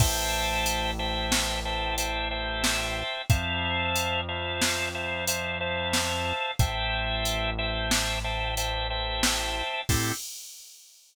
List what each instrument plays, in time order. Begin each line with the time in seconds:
0.00 synth bass 1 A1, drawbar organ C5 E5 G5 A5, kick, crash
0.66 closed hi-hat
0.99 drawbar organ C5 E5 G5 A5
1.32 snare
1.65 drawbar organ C5 E5 G5 A5
1.98 drawbar organ C5 E5 G5 A5, closed hi-hat
2.31 drawbar organ C5 E5 G5 A5
2.64 snare
3.30 synth bass 1 F2, drawbar organ C5 E5 F5 A5, kick, closed hi-hat
3.96 closed hi-hat
4.28 drawbar organ C5 E5 F5 A5
4.62 snare
4.95 drawbar organ C5 E5 F5 A5
5.27 drawbar organ C5 E5 F5 A5, closed hi-hat
5.60 drawbar organ C5 E5 F5 A5
5.93 snare
6.59 synth bass 1 A1, drawbar organ C5 E5 G5 A5, kick, closed hi-hat
7.25 closed hi-hat
7.58 drawbar organ C5 E5 G5 A5
7.91 snare
8.24 drawbar organ C5 E5 G5 A5
8.57 drawbar organ C5 E5 G5 A5, closed hi-hat
8.90 drawbar organ C5 E5 G5 A5
9.23 snare
9.89 synth bass 1 A2, drawbar organ C4 E4 G4 A4, kick, crash